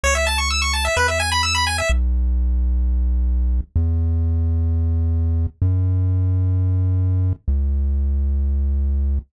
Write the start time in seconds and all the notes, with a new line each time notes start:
0.03 C#2 C#5
0.15 E5
0.27 A5
0.38 C#6
0.50 E6
0.62 C#6
0.73 A5
0.85 E5
0.97 E2 B4
1.08 E5
1.20 G#5
1.32 B5
1.43 E6
1.55 B5
1.67 G#5
1.78 E5
1.89 B1
3.76 E2
5.62 F#2
7.48 C#2